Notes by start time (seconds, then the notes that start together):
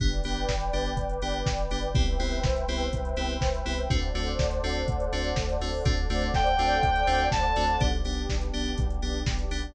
0.00 G1 B3 D4 G4 B4 D5 G5, kick, closed hi-hat
0.13 closed hi-hat
0.24 G1 B3 D4 G4, open hi-hat
0.36 closed hi-hat
0.49 G1, kick, snare
0.61 closed hi-hat
0.73 G1 B3 D4 G4, open hi-hat
0.86 closed hi-hat
0.97 G1, kick, closed hi-hat
1.09 closed hi-hat
1.22 G1 B3 D4 G4, open hi-hat
1.34 closed hi-hat
1.46 G1, kick, snare
1.58 closed hi-hat
1.71 G1 B3 D4 G4, open hi-hat
1.83 closed hi-hat
1.94 C2 B3 C4 E4 G4 B4 C5 E5 G5, kick, closed hi-hat
2.07 closed hi-hat
2.20 C2 B3 C4 E4 G4, open hi-hat
2.32 closed hi-hat
2.43 C2, kick, snare
2.56 closed hi-hat
2.68 C2 B3 C4 E4 G4, open hi-hat
2.80 closed hi-hat
2.93 C2, kick, closed hi-hat
3.05 closed hi-hat
3.16 C2 B3 C4 E4 G4, open hi-hat
3.29 closed hi-hat
3.41 C2, kick, snare
3.54 closed hi-hat
3.66 C2 B3 C4 E4 G4, open hi-hat
3.78 closed hi-hat
3.90 D2 A3 C4 D4 F#4 A4 C5 D5 F#5, kick, closed hi-hat
4.02 closed hi-hat
4.14 D2 A3 C4 D4 F#4, open hi-hat
4.27 closed hi-hat
4.39 D2, kick, snare
4.51 closed hi-hat
4.64 D2 A3 C4 D4 F#4, open hi-hat
4.75 closed hi-hat
4.88 D2, kick, closed hi-hat
5.00 closed hi-hat
5.12 D2 A3 C4 D4 F#4, open hi-hat
5.24 closed hi-hat
5.36 D2, kick, snare
5.49 closed hi-hat
5.60 D2 A3 C4 D4 F#4, open hi-hat
5.73 open hi-hat
5.85 D2 A3 C4 D4 F#4 A4 C5 D5 F#5, kick, closed hi-hat
5.97 closed hi-hat
6.10 D2 A3 C4 D4 F#4, open hi-hat
6.22 closed hi-hat
6.34 D2 G5, kick, snare
6.47 closed hi-hat
6.59 D2 A3 C4 D4 F#4, open hi-hat
6.71 closed hi-hat
6.83 D2, kick, closed hi-hat
6.96 closed hi-hat
7.07 D2 A3 C4 D4 F#4, open hi-hat
7.20 closed hi-hat
7.32 D2 A5, kick, snare
7.44 closed hi-hat
7.56 D2 A3 C4 D4 F#4, open hi-hat
7.69 closed hi-hat
7.80 B1 B3 D4 G4, kick, closed hi-hat
7.93 closed hi-hat
8.04 B1 B3 D4 G4, open hi-hat
8.17 closed hi-hat
8.29 B1, kick, snare
8.41 closed hi-hat
8.53 B1 B3 D4 G4, open hi-hat
8.66 closed hi-hat
8.78 B1, kick, closed hi-hat
8.90 closed hi-hat
9.02 B1 B3 D4 G4, open hi-hat
9.15 closed hi-hat
9.26 B1, kick, snare
9.39 closed hi-hat
9.51 B1 B3 D4 G4, open hi-hat
9.63 closed hi-hat